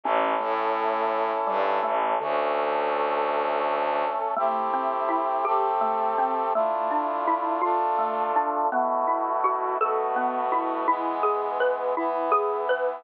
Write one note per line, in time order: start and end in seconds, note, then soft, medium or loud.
0.04 0.34 A1 medium
0.04 2.19 C#4 medium
0.04 0.38 C#4 loud
0.04 2.19 E4 medium
0.04 2.19 A4 medium
0.40 1.32 A2 medium
0.40 1.32 A3 medium
1.47 1.79 G2 medium
1.47 1.78 G3 medium
1.83 2.15 A1 medium
1.83 2.13 A3 medium
2.20 4.05 D2 medium
2.20 4.04 D3 medium
2.20 4.34 A3 medium
2.20 4.34 C#4 medium
2.20 4.34 A4 medium
4.36 4.69 A3 medium
4.36 5.45 A3 medium
4.36 5.45 C4 medium
4.36 5.45 E4 medium
4.36 5.45 G4 medium
4.73 5.06 C4 medium
5.09 5.41 E4 medium
5.45 6.53 A3 medium
5.45 6.53 C4 medium
5.45 5.77 G4 medium
5.45 6.53 G4 medium
5.45 6.53 A4 medium
5.81 6.13 A3 medium
6.18 6.50 C4 medium
6.54 7.62 A3 medium
6.54 6.88 A3 loud
6.54 7.62 D4 medium
6.54 7.62 E4 medium
6.54 7.62 F4 medium
6.91 7.23 D4 medium
7.27 7.60 E4 medium
7.61 8.70 A3 medium
7.61 8.70 D4 medium
7.61 7.94 F4 medium
7.61 8.70 F4 medium
7.61 8.70 A4 medium
7.98 8.31 A3 medium
8.36 8.68 D4 medium
8.71 9.78 B2 medium
8.71 9.78 A3 medium
8.71 9.05 B3 medium
8.71 9.78 E4 medium
8.71 9.78 F#4 medium
9.07 9.40 E4 medium
9.44 9.76 F#4 medium
9.80 10.87 B2 medium
9.80 10.87 A3 medium
9.80 10.87 B3 medium
9.80 10.87 F#4 medium
9.80 10.13 A4 medium
10.16 10.48 B3 medium
10.52 10.84 E4 medium
10.88 11.95 E3 medium
10.88 11.95 G#3 medium
10.88 11.95 B3 medium
10.88 11.20 E4 medium
11.23 11.55 G#4 medium
11.60 11.93 B4 medium
11.97 13.04 E3 medium
11.97 13.04 B3 medium
11.97 12.29 E4 medium
11.97 13.04 E4 medium
12.31 12.64 G#4 medium
12.69 13.02 B4 medium